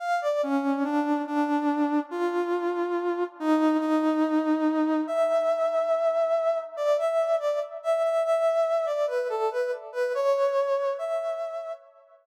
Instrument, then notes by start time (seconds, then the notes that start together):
brass section
0.00 F5
0.21 D5
0.43 C#4
0.84 D4
1.27 D4
2.11 F4
3.40 D#4
3.80 D#4
5.07 E5
6.77 D5
6.98 E5
7.39 D5
7.83 E5
8.03 E5
8.24 E5
8.86 D5
9.07 B4
9.29 A4
9.51 B4
9.92 B4
10.15 C#5
10.98 E5